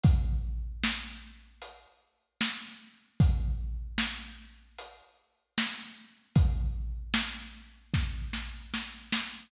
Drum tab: HH |x---x---|x---x---|x-------|
SD |--o---o-|--o---o-|--o-oooo|
BD |o-------|o-------|o---o---|